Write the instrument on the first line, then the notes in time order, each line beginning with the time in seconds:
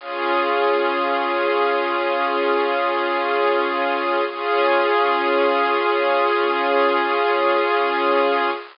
string ensemble 1
0.00 C#4 F4 G#4
4.28 C#4 F4 G#4